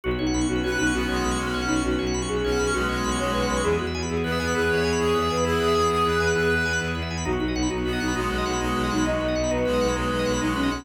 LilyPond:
<<
  \new Staff \with { instrumentName = "Flute" } { \time 12/8 \key b \mixolydian \tempo 4. = 133 fis'8 dis'4 fis'8 fis'8 dis'8 fis'2~ fis'8 dis'8 | fis'4. gis'4. fis'4. cis''8 b'8 b'8 | gis'8 fis'4 gis'8 b'8 b'8 gis'2~ gis'8 b'8 | gis'1 r2 |
fis'8 dis'4 fis'8 fis'8 dis'8 fis'2~ fis'8 dis'8 | dis''4. b'4. b'4. dis'8 cis'8 cis'8 | }
  \new Staff \with { instrumentName = "Clarinet" } { \time 12/8 \key b \mixolydian r2 b'4 b8 gis4 cis'4. | r2 cis'4 gis8 gis4 gis4. | r2 b4 b'8 cis''4 gis'4. | e'8 gis'8 gis'8 gis'8 b'4 b'4. r4. |
r2 b4 gis8 gis4 gis4. | r2 gis4 gis8 gis4 gis4. | }
  \new Staff \with { instrumentName = "Drawbar Organ" } { \time 12/8 \key b \mixolydian fis'16 b'16 cis''16 fis''16 b''16 cis'''16 fis'16 b'16 cis''16 fis''16 b''16 cis'''16 fis'16 b'16 cis''16 fis''16 b''16 cis'''16 fis'16 b'16 cis''16 fis''16 b''16 cis'''16 | fis'16 b'16 cis''16 fis''16 b''16 cis'''16 fis'16 b'16 cis''16 fis''16 b''16 cis'''16 fis'16 b'16 cis''16 fis''16 b''16 cis'''16 fis'16 b'16 cis''16 fis''16 b''16 cis'''16 | e'16 gis'16 b'16 e''16 gis''16 b''16 e'16 gis'16 b'16 e''16 gis''16 b''16 e'16 gis'16 b'16 e''16 gis''16 b''16 e'16 gis'16 b'16 e''16 gis''16 b''16 | e'16 gis'16 b'16 e''16 gis''16 b''16 e'16 gis'16 b'16 e''16 gis''16 b''16 e'16 gis'16 b'16 e''16 gis''16 b''16 e'16 gis'16 b'16 e''16 gis''16 b''16 |
dis'16 fis'16 b'16 dis''16 fis''16 b''16 dis'16 fis'16 b'16 dis''16 fis''16 b''16 dis'16 fis'16 b'16 dis''16 fis''16 b''16 dis'16 fis'16 b'16 dis''16 fis''16 b''16 | dis'16 fis'16 b'16 dis''16 fis''16 b''16 dis'16 fis'16 b'16 dis''16 fis''16 b''16 dis'16 fis'16 b'16 dis''16 fis''16 b''16 dis'16 fis'16 b'16 dis''16 fis''16 b''16 | }
  \new Staff \with { instrumentName = "Violin" } { \clef bass \time 12/8 \key b \mixolydian b,,8 b,,8 b,,8 b,,8 b,,8 b,,8 b,,8 b,,8 b,,8 b,,8 b,,8 b,,8 | b,,8 b,,8 b,,8 b,,8 b,,8 b,,8 b,,8 b,,8 b,,8 b,,8 b,,8 b,,8 | e,8 e,8 e,8 e,8 e,8 e,8 e,8 e,8 e,8 e,8 e,8 e,8 | e,8 e,8 e,8 e,8 e,8 e,8 e,8 e,8 e,8 e,8 e,8 e,8 |
b,,8 b,,8 b,,8 b,,8 b,,8 b,,8 b,,8 b,,8 b,,8 b,,8 b,,8 b,,8 | b,,8 b,,8 b,,8 b,,8 b,,8 b,,8 b,,8 b,,8 b,,8 b,,8 b,,8 b,,8 | }
  \new Staff \with { instrumentName = "Pad 5 (bowed)" } { \time 12/8 \key b \mixolydian <b cis' fis'>1.~ | <b cis' fis'>1. | <b e' gis'>1.~ | <b e' gis'>1. |
<b dis' fis'>1.~ | <b dis' fis'>1. | }
>>